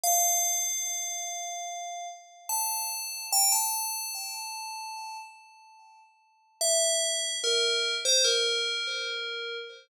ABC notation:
X:1
M:4/4
L:1/16
Q:1/4=73
K:F
V:1 name="Tubular Bells"
f12 a4 | g a9 z6 | e4 B3 c B8 |]